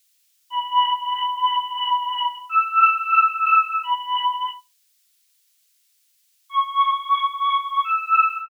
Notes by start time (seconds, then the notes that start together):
0.50 B5
2.49 E6
3.83 B5
6.49 C#6
7.84 E6